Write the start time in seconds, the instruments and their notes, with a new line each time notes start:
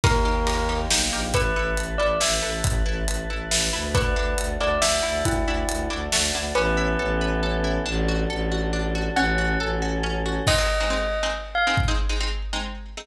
0.04 violin D#2, choir aahs A#3 D#4 G4, pizzicato strings D#4 G4 A#4, tubular bells A#4, kick, ride
0.25 pizzicato strings D#4 G4 A#4
0.47 pizzicato strings D#4 G4 A#4, ride
0.69 pizzicato strings D#4 G4 A#4
0.90 violin B1, pizzicato strings D#4 G4 A#4, snare
1.12 violin A#1, pizzicato strings D#4 G4 A#4
1.34 violin A1, pizzicato strings E4 A4 B4, tubular bells B4, choir aahs B4 E5 A5, kick, closed hi-hat
1.56 violin A1, pizzicato strings E4 A4 B4
1.77 violin A1, closed hi-hat
1.98 violin A1, pizzicato strings E4 A4 B4, tubular bells D5
2.20 violin A1, pizzicato strings E4 A4 B4, tubular bells E5, snare
2.42 violin A1, pizzicato strings E4 A4 B4
2.64 violin A1, kick, closed hi-hat
2.86 violin A1, pizzicato strings E4 A4 B4
3.08 violin A1, closed hi-hat
3.30 violin A1, pizzicato strings E4 A4 B4
3.51 violin A1, pizzicato strings E4 A4 B4, snare
3.73 violin D2, pizzicato strings E4 A4 B4
3.94 pizzicato strings D4 E4 F#4 A4, tubular bells B4, choir aahs D5 E5 F#5 A5, kick, closed hi-hat
4.16 violin D2, pizzicato strings D4 E4 F#4 A4
4.38 violin D2, closed hi-hat
4.60 violin D2, pizzicato strings D4 E4 F#4 A4, tubular bells D5
4.82 violin D2, pizzicato strings D4 E4 F#4 A4, tubular bells E5, snare
5.03 violin D2, pizzicato strings D4 E4 F#4 A4
5.25 violin D2, tubular bells E4, kick, closed hi-hat
5.46 violin D2, pizzicato strings D4 E4 F#4 A4
5.69 violin D2, closed hi-hat
5.90 violin D2, pizzicato strings D4 E4 F#4 A4
6.12 violin D2, pizzicato strings D4 E4 F#4 A4, snare
6.34 violin D2, pizzicato strings D4 E4 F#4 A4
6.55 violin A1, choir aahs B3 C#4 E4 A4, pizzicato strings C#4, tubular bells B4
6.77 pizzicato strings E4
6.99 violin A1, pizzicato strings A4
7.21 pizzicato strings B4
7.43 pizzicato strings A4
7.64 pizzicato strings E4
7.86 violin A1, pizzicato strings D4, choir aahs D4 F#4 A4
8.09 pizzicato strings F#4
8.30 violin A1, pizzicato strings A4
8.52 pizzicato strings F#4
8.73 pizzicato strings D4
8.95 pizzicato strings F#4
9.16 violin A1, pizzicato strings C#4, choir aahs C#4 F#4 A4, tubular bells F#5
9.38 pizzicato strings F#4
9.60 violin A1, pizzicato strings A4
9.82 pizzicato strings F#4
10.03 pizzicato strings C#4
10.26 pizzicato strings F#4
10.47 pizzicato strings G#3 C4 D#4, tubular bells D#5, kick, crash
10.58 pizzicato strings G#3 C4 D#4
10.80 pizzicato strings G#3 C4 D#4
10.90 pizzicato strings G#3 C4 D#4
11.23 pizzicato strings G#3 C4 D#4
11.55 tubular bells F5
11.67 pizzicato strings G#3 C4 D#4
11.77 kick
11.88 pizzicato strings G#3 C4 D#4
12.09 pizzicato strings G#3 C4 D#4
12.20 pizzicato strings G#3 C4 D#4
12.53 pizzicato strings G#3 C4 D#4
12.97 pizzicato strings G#3 C4 D#4